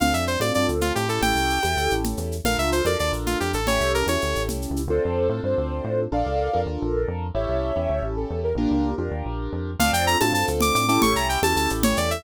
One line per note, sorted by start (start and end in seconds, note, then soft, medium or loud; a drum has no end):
0.00 0.13 D2 medium
0.00 0.36 C4 medium
0.00 0.36 D4 medium
0.00 0.36 F4 medium
0.00 0.36 A4 medium
0.00 0.13 F5 medium
0.00 low conga medium
0.00 shaker medium
0.14 0.37 F2 medium
0.14 0.25 E5 medium
0.14 shaker medium
0.27 0.39 C5 medium
0.27 shaker medium
0.40 0.51 A2 medium
0.40 1.05 C4 medium
0.40 1.05 D4 medium
0.40 1.05 F4 medium
0.40 1.05 A4 medium
0.40 0.52 D5 medium
0.40 high conga medium
0.40 shaker medium
0.54 0.67 G2 medium
0.54 0.67 D5 medium
0.54 shaker medium
0.68 0.92 D2 medium
0.68 shaker medium
0.81 0.93 F4 medium
0.81 low conga medium
0.81 shaker medium
0.95 1.19 A2 medium
0.95 1.08 G4 medium
0.95 shaker medium
1.09 1.59 C#4 medium
1.09 1.59 E4 medium
1.09 1.59 G4 medium
1.09 1.59 A4 medium
1.09 1.21 A4 medium
1.09 shaker medium
1.22 1.33 A1 medium
1.22 1.94 G5 medium
1.22 low conga medium
1.22 shaker medium
1.35 1.59 C2 medium
1.35 shaker medium
1.50 shaker medium
1.63 1.75 E2 medium
1.63 2.36 C#4 medium
1.63 2.36 E4 medium
1.63 2.36 G4 medium
1.63 2.36 A4 medium
1.63 high conga medium
1.63 shaker medium
1.77 1.88 D2 medium
1.77 shaker medium
1.90 2.14 A1 medium
1.90 shaker medium
2.04 low conga medium
2.04 shaker medium
2.17 2.41 E2 medium
2.17 shaker medium
2.32 shaker medium
2.44 2.56 A#1 medium
2.44 2.82 D4 medium
2.44 2.82 F4 medium
2.44 2.82 A4 medium
2.44 2.82 A#4 medium
2.44 2.57 F5 medium
2.44 low conga medium
2.44 shaker medium
2.58 2.82 C#2 medium
2.58 2.70 E5 medium
2.58 shaker medium
2.72 2.85 C5 medium
2.72 shaker medium
2.85 2.96 F2 medium
2.85 3.59 D4 medium
2.85 3.59 F4 medium
2.85 3.59 A4 medium
2.85 3.59 A#4 medium
2.85 2.97 D5 medium
2.85 high conga medium
2.85 shaker medium
2.99 3.12 D#2 medium
2.99 3.12 D5 medium
2.99 shaker medium
3.12 3.35 A#1 medium
3.12 shaker medium
3.26 3.38 F4 medium
3.26 low conga medium
3.26 shaker medium
3.40 3.54 F2 medium
3.40 3.52 G4 medium
3.40 shaker medium
3.53 3.79 A1 medium
3.53 3.67 A4 medium
3.53 shaker medium
3.67 4.04 C#4 medium
3.67 4.04 E4 medium
3.67 4.04 G4 medium
3.67 4.04 A4 medium
3.67 3.92 C#5 medium
3.67 low conga medium
3.67 shaker medium
3.80 4.03 C2 medium
3.80 shaker medium
3.94 4.06 A#4 medium
3.94 shaker medium
4.06 4.18 E2 medium
4.06 4.82 C#4 medium
4.06 4.82 E4 medium
4.06 4.82 G4 medium
4.06 4.82 A4 medium
4.06 4.42 C#5 medium
4.06 high conga medium
4.06 shaker medium
4.21 4.34 D2 medium
4.21 shaker medium
4.35 4.49 A1 medium
4.35 shaker medium
4.48 4.67 C2 medium
4.48 low conga medium
4.48 shaker medium
4.62 shaker medium
4.70 4.89 C#2 medium
4.76 shaker medium
4.88 4.99 D2 medium
4.88 5.27 C4 medium
4.88 5.27 D4 medium
4.88 5.27 F4 medium
4.88 5.41 A4 medium
4.88 5.27 A4 medium
4.88 5.41 C5 medium
5.05 5.28 F2 medium
5.29 5.41 A2 medium
5.29 6.04 C4 medium
5.29 6.04 D4 medium
5.29 6.04 F4 medium
5.29 6.04 A4 medium
5.43 5.55 G2 medium
5.43 6.00 C5 medium
5.58 5.81 D2 medium
5.84 6.07 A2 medium
6.12 6.23 A#1 medium
6.12 6.49 D4 medium
6.12 6.49 F4 medium
6.12 6.49 A4 medium
6.12 6.49 A#4 medium
6.12 6.60 D5 medium
6.12 6.60 F5 medium
6.26 6.49 C#2 medium
6.53 6.66 F2 medium
6.53 7.27 D4 medium
6.53 7.27 F4 medium
6.53 7.27 A4 medium
6.53 7.27 A#4 medium
6.66 6.78 D#2 medium
6.82 7.05 A#1 medium
7.08 7.31 F2 medium
7.34 7.46 A1 medium
7.34 7.71 C#4 medium
7.34 7.71 E4 medium
7.34 7.71 G4 medium
7.34 7.71 A4 medium
7.34 8.03 C#5 medium
7.34 8.03 E5 medium
7.49 7.72 C2 medium
7.76 7.88 E2 medium
7.76 8.49 C#4 medium
7.76 8.49 E4 medium
7.76 8.49 G4 medium
7.76 8.49 A4 medium
7.89 8.01 D2 medium
8.02 8.26 A1 medium
8.16 8.40 A4 medium
8.30 8.54 E2 medium
8.43 8.55 A#4 medium
8.55 8.67 A#1 medium
8.55 8.91 A#3 medium
8.55 8.91 D4 medium
8.55 8.94 D4 medium
8.55 8.94 F4 medium
8.55 8.94 G4 medium
8.55 8.94 A#4 medium
8.71 8.94 C#2 medium
8.98 9.10 F2 medium
8.98 9.71 D4 medium
8.98 9.71 F4 medium
8.98 9.71 G4 medium
8.98 9.71 A#4 medium
9.11 9.23 D#2 medium
9.25 9.49 A#1 medium
9.53 9.76 F2 medium
9.79 9.91 D2 medium
9.79 10.16 C4 loud
9.79 10.16 D4 loud
9.79 10.16 F4 loud
9.79 10.16 A4 medium
9.79 9.91 F5 medium
9.79 low conga loud
9.79 shaker loud
9.93 10.16 F2 medium
9.93 10.05 G5 medium
9.93 shaker medium
10.07 10.18 A#5 medium
10.07 shaker medium
10.20 10.33 A2 medium
10.20 10.85 C4 medium
10.20 10.85 D4 medium
10.20 10.85 F4 medium
10.20 10.85 A4 medium
10.20 10.32 A5 medium
10.20 high conga loud
10.20 shaker medium
10.32 10.44 G2 medium
10.32 10.45 A5 medium
10.32 shaker medium
10.47 10.71 D2 medium
10.47 shaker medium
10.60 10.74 D6 medium
10.60 low conga loud
10.60 shaker medium
10.75 10.98 A2 medium
10.75 10.87 D6 medium
10.75 shaker medium
10.88 11.39 C#4 loud
10.88 11.39 E4 loud
10.88 11.39 G4 loud
10.88 11.39 A4 loud
10.88 11.00 D6 medium
10.88 shaker medium
11.02 11.14 A1 medium
11.02 11.14 C#6 medium
11.02 low conga loud
11.02 shaker medium
11.14 11.37 C2 medium
11.14 11.27 A#5 medium
11.14 shaker medium
11.29 11.40 G5 medium
11.29 shaker medium
11.42 11.54 E2 medium
11.42 12.16 C#4 medium
11.42 12.16 E4 medium
11.42 12.16 G4 medium
11.42 12.16 A4 medium
11.42 11.56 A5 medium
11.42 high conga loud
11.42 shaker medium
11.56 11.68 D2 medium
11.56 11.69 A5 medium
11.56 shaker medium
11.69 11.94 A1 medium
11.69 shaker medium
11.83 11.97 C#5 medium
11.83 low conga loud
11.83 shaker medium
11.97 12.21 E2 medium
11.97 12.10 D5 medium
11.97 shaker medium
12.11 12.23 E5 medium
12.11 shaker medium